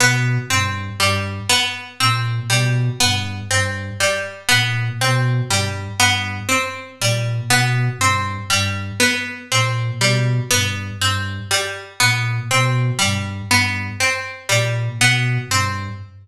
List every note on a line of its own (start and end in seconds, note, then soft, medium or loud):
0.00 0.38 B2 medium
0.00 0.40 B3 medium
0.50 0.90 G2 medium
0.50 0.90 C4 medium
1.00 1.40 G2 medium
1.00 1.40 G3 medium
1.49 1.89 B3 medium
2.00 2.40 A#2 medium
2.00 2.40 C4 medium
2.50 2.90 B2 medium
2.50 2.90 G3 medium
3.00 3.41 G2 medium
3.00 3.40 B3 medium
3.51 3.91 G2 medium
3.51 3.91 C4 medium
4.00 4.40 G3 medium
4.49 4.90 A#2 medium
4.49 4.89 B3 medium
5.01 5.41 B2 medium
5.01 5.41 C4 medium
5.49 5.89 G2 medium
5.49 5.90 G3 medium
6.00 6.40 G2 medium
6.00 6.40 B3 medium
6.49 6.89 C4 medium
7.00 7.40 A#2 medium
7.00 7.41 G3 medium
7.49 7.89 B2 medium
7.49 7.90 B3 medium
7.98 8.38 G2 medium
7.98 8.41 C4 medium
8.50 8.91 G2 medium
8.50 8.90 G3 medium
9.00 9.40 B3 medium
9.51 9.91 A#2 medium
9.51 9.92 C4 medium
10.00 10.40 B2 medium
10.00 10.41 G3 medium
10.51 10.91 G2 medium
10.51 10.91 B3 medium
11.00 11.40 G2 medium
11.00 11.41 C4 medium
11.51 11.91 G3 medium
12.00 12.40 A#2 medium
12.00 12.40 B3 medium
12.51 12.91 B2 medium
12.51 12.91 C4 medium
12.99 13.42 G2 medium
12.99 13.39 G3 medium
13.50 13.90 G2 medium
13.50 13.91 B3 medium
14.00 14.40 C4 medium
14.49 14.89 A#2 medium
14.49 14.89 G3 medium
14.98 15.38 B2 medium
14.98 15.41 B3 medium
15.49 15.89 G2 medium
15.49 15.91 C4 medium